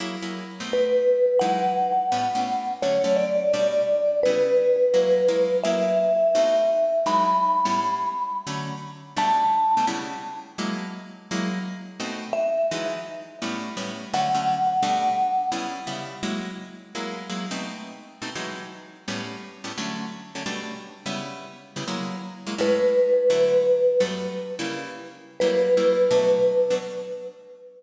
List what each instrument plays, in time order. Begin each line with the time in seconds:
0.00 acoustic guitar (steel) F#3 A#3 E4 G#4
0.22 acoustic guitar (steel) F#3 A#3 E4 G#4
0.60 acoustic guitar (steel) B2 A3 C4 D#4
0.73 vibraphone B4
1.39 acoustic guitar (steel) E3 F#3 G#3 D#4, vibraphone F#5
2.12 acoustic guitar (steel) A2 G3 B3 C#4
2.35 acoustic guitar (steel) A2 G3 B3 C#4
2.82 acoustic guitar (steel) D3 F#3 A3 C#4, vibraphone C#5
3.04 acoustic guitar (steel) D3 F#3 A3 C#4
3.16 vibraphone D5
3.53 acoustic guitar (steel) B2 G3 A3 D4
4.23 acoustic guitar (steel) C#3 G3 B3 E4, vibraphone B4
4.94 acoustic guitar (steel) F#3 G#3 A#3 E4
5.28 acoustic guitar (steel) F#3 G#3 A#3 E4
5.63 acoustic guitar (steel) F#3 A#3 E4 G#4, vibraphone E5
6.35 acoustic guitar (steel) B2 A3 C4 D#4
7.06 acoustic guitar (steel) E3 F#3 G#3 D#4, vibraphone B5
7.65 acoustic guitar (steel) A2 G3 B3 C#4
8.47 acoustic guitar (steel) D3 F#3 A3 C#4
9.16 acoustic guitar (steel) B2 G3 A3 D4, vibraphone A5
9.77 acoustic guitar (steel) B2 G3 A3 D4
9.87 acoustic guitar (steel) C#3 G3 B3 E4
10.58 acoustic guitar (steel) F#3 G#3 A#3 E4
11.31 acoustic guitar (steel) F#3 G#3 A#3 E4
11.99 acoustic guitar (steel) B2 A3 C4 D#4
12.33 vibraphone E5
12.71 acoustic guitar (steel) E3 F#3 G#3 D#4
13.42 acoustic guitar (steel) A2 G3 B3 C#4
13.77 acoustic guitar (steel) A2 G3 B3 C#4
14.14 acoustic guitar (steel) D3 F#3 A3 C#4, vibraphone F#5
14.35 acoustic guitar (steel) D3 F#3 A3 C#4
14.82 acoustic guitar (steel) B2 G3 A3 D4
15.52 acoustic guitar (steel) C#3 G3 B3 E4
15.87 acoustic guitar (steel) C#3 G3 B3 E4
16.23 acoustic guitar (steel) F#3 G#3 A#3 E4
16.95 acoustic guitar (steel) F#3 G#3 A#3 E4
17.30 acoustic guitar (steel) F#3 G#3 A#3 E4
17.51 acoustic guitar (steel) B2 A3 C4 D#4
18.22 acoustic guitar (steel) B2 A3 C4 D#4
18.35 acoustic guitar (steel) E3 F#3 G#3 D#4
19.08 acoustic guitar (steel) A2 G3 B3 C#4
19.64 acoustic guitar (steel) A2 G3 B3 C#4
19.78 acoustic guitar (steel) D3 F#3 A3 C#4
20.35 acoustic guitar (steel) D3 F#3 A3 C#4
20.46 acoustic guitar (steel) B2 G3 A3 D4
21.06 acoustic guitar (steel) C#3 G3 B3 E4
21.76 acoustic guitar (steel) C#3 G3 B3 E4
21.88 acoustic guitar (steel) F#3 G#3 A#3 E4
22.46 acoustic guitar (steel) F#3 G#3 A#3 E4
22.58 acoustic guitar (steel) A2 G#3 C#4 E4, vibraphone B4
23.30 acoustic guitar (steel) D3 F#3 A3 E4
24.00 acoustic guitar (steel) G2 F#3 A3 B3
24.59 acoustic guitar (steel) C#3 G3 A#3 E4
25.40 acoustic guitar (steel) F#3 G3 A#3 E4, vibraphone B4
25.77 acoustic guitar (steel) F#3 G3 A#3 E4
26.11 acoustic guitar (steel) B2 F#3 A3 D4
26.70 acoustic guitar (steel) B2 F#3 A3 D4